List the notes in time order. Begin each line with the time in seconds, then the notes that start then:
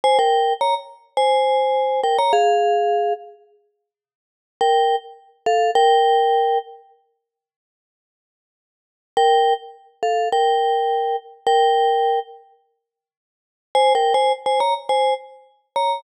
0.04 C5 G#5
0.19 A#4 G5
0.61 C#5 A#5
1.17 C5 G#5
2.03 A#4 G5
2.18 C#5 A#5
2.33 G#4 F5
4.61 A#4 G5
5.46 A4 F5
5.75 A#4 G5
9.17 A#4 G5
10.03 A4 F5
10.32 A#4 G5
11.47 A#4 G5
13.75 C5 G#5
13.95 A#4 G5
14.14 C5 G#5
14.46 C5 G#5
14.60 C#5 A#5
14.89 C5 G#5
15.76 C#5 A#5